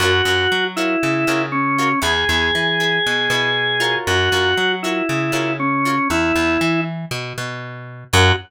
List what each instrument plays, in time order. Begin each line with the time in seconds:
0.00 electric bass (finger) F#2, acoustic guitar (steel) F4 F#4 A#4 C#5, drawbar organ F#4
0.25 electric bass (finger) F#2, acoustic guitar (steel) F4 F#4 A#4 C#5
0.52 electric bass (finger) F#3
0.76 drawbar organ E4, acoustic guitar (steel) F4 F#4 A#4 C#5
1.03 electric bass (finger) C#3
1.27 electric bass (finger) C#3, acoustic guitar (steel) F4 F#4 A#4 C#5
1.52 drawbar organ C#4
1.78 acoustic guitar (steel) F4 F#4 A#4 C#5
2.02 electric bass (finger) E2, acoustic guitar (steel) E4 G#4 B4, drawbar organ G#4
2.29 electric bass (finger) E2, acoustic guitar (steel) E4 G#4 B4
2.55 electric bass (finger) E3
2.80 acoustic guitar (steel) E4 G#4 B4
3.06 electric bass (finger) B2
3.30 electric bass (finger) B2, acoustic guitar (steel) E4 G#4 B4
3.80 acoustic guitar (steel) F4 F#4 A#4 C#5
4.07 electric bass (finger) F#2, drawbar organ F#4
4.32 electric bass (finger) F#2, acoustic guitar (steel) F4 F#4 A#4 C#5
4.58 electric bass (finger) F#3
4.83 drawbar organ E4, acoustic guitar (steel) F4 F#4 A#4 C#5
5.09 electric bass (finger) C#3
5.32 electric bass (finger) C#3, acoustic guitar (steel) F4 F#4 A#4 C#5
5.60 drawbar organ C#4
5.85 acoustic guitar (steel) F4 F#4 A#4 C#5
6.10 electric bass (finger) E2, drawbar organ E4
6.35 electric bass (finger) E2
6.61 electric bass (finger) E3
7.11 electric bass (finger) B2
7.38 electric bass (finger) B2
8.13 electric bass (finger) F#2, acoustic guitar (steel) F4 F#4 A#4 C#5, drawbar organ F#4